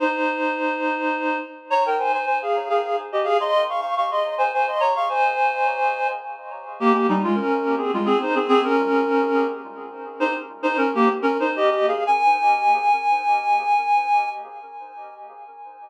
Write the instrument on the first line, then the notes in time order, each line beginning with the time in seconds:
clarinet
0.00 D#4 C5
1.70 C#5 A#5
1.86 A#4 G5
1.99 C5 G#5
2.13 C5 G#5
2.25 C5 G#5
2.42 G#4 F5
2.69 G#4 F5
2.83 G#4 F5
3.12 G4 D#5
3.24 G#4 F5
3.40 D#5 C6
3.69 F5 C#6
3.81 F5 C#6
3.97 F5 C#6
4.11 D#5 C6
4.38 C5 G#5
4.53 C5 G#5
4.68 D#5 C6
4.80 C#5 A#5
4.95 F5 C#6
5.09 C5 G#5
6.80 A#3 G4
6.93 A#3 G4
7.09 G3 D#4
7.23 G#3 F4
7.35 C#4 A#4
7.78 C4 G#4
7.94 G#3 F4
8.05 C4 G#4
8.21 D#4 C5
8.35 C4 G#4
8.48 C4 G#4
8.64 C#4 A#4
10.20 D#4 C5
10.63 D#4 C5
10.77 C#4 A#4
10.94 A#3 G4
11.22 C#4 A#4
11.40 D#4 C5
11.56 G4 D#5
11.70 G4 D#5
11.88 G#4 F5
12.07 G#5